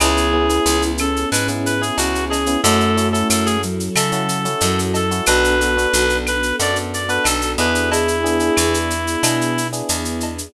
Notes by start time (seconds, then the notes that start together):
0.00 C#2 B3 C#4 E4 G#4, cowbell, claves, shaker
0.17 shaker
0.33 B3 C#4 E4 G#4
0.49 B3 C#4 E4 G#4, shaker
0.66 C#2, shaker
0.82 shaker
0.98 C#4 A4, claves, shaker
1.16 shaker
1.32 G#2 B4, cowbell, shaker
1.48 B3 C#4 E4 G#4, shaker
1.66 B4, shaker
1.81 B3 C#4 E4 G#4, shaker
1.98 C#2 C#4 F#4, cowbell, shaker
2.15 shaker
2.30 G#4, cowbell, shaker
2.46 B3 C#4 E4 G#4, shaker
2.63 F#2 A3 C#4 E4 F#4 A4, cowbell, shaker
2.80 shaker
2.97 C#4 E4 F#4 A4, shaker
3.12 C#4 E4 F#4 A4, shaker
3.30 F#2 A4, claves, shaker
3.46 G#4, shaker
3.62 F#3, shaker
3.80 shaker
3.95 C#3 A4, cowbell, claves, shaker
4.12 C#4 E4 F#4 A4, shaker
4.29 shaker
4.45 C#4 E4 F#4 A4, shaker
4.60 F#2 F#3, cowbell, shaker
4.79 shaker
4.94 A4, cowbell, shaker
5.11 C#4 E4 F#4 A4, shaker
5.26 B1 B3 D4 F#4 A4 B4, cowbell, claves, shaker
5.44 shaker
5.60 B3 D4 F#4 A4, shaker
5.77 B3 D4 F#4 A4, shaker
5.93 B1, shaker
6.09 shaker
6.27 B4, claves, shaker
6.43 shaker
6.59 F#2 B3 D4 F#4 A4 D5, cowbell, shaker
6.76 shaker
6.94 D5, shaker
7.09 B3 D4 F#4 A4 B4, shaker
7.24 B1 A4, cowbell, claves, shaker
7.41 shaker
7.58 E2 B3 D4 E4 G#4 B4, cowbell, shaker
7.75 shaker
7.91 B3 D4 E4 G#4, cowbell, shaker
8.08 shaker
8.24 B3 D4 E4 G#4, shaker
8.40 B3 D4 E4 G#4, shaker
8.57 E2, claves, shaker
8.74 shaker
8.90 shaker
9.07 shaker
9.23 B2 B3 D4 E4 G#4, cowbell, claves, shaker
9.41 shaker
9.58 shaker
9.73 B3 D4 E4 G#4, shaker
9.89 E2, cowbell, shaker
10.05 shaker
10.20 cowbell, shaker
10.38 shaker